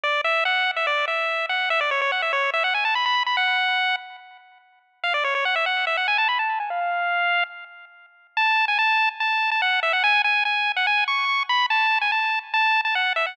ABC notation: X:1
M:4/4
L:1/16
Q:1/4=144
K:F#m
V:1 name="Lead 1 (square)"
d2 e2 f3 e d2 e4 f2 | e d c c f e c2 e f g a b b2 b | f6 z10 | ^e d c c f =e f2 e f g a b a2 g |
^e8 z8 | a3 g a3 z a3 a f2 e f | g2 g2 g3 f g2 c'4 b2 | a3 g a3 z a3 a f2 e f |]